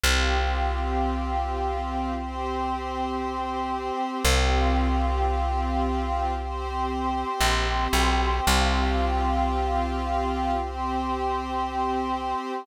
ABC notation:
X:1
M:4/4
L:1/8
Q:1/4=57
K:Cmix
V:1 name="Pad 5 (bowed)"
[CFG]4 [CGc]4 | [CFG]4 [CGc]4 | [CFG]4 [CGc]4 |]
V:2 name="Electric Bass (finger)" clef=bass
C,,8 | C,,6 B,,, =B,,, | C,,8 |]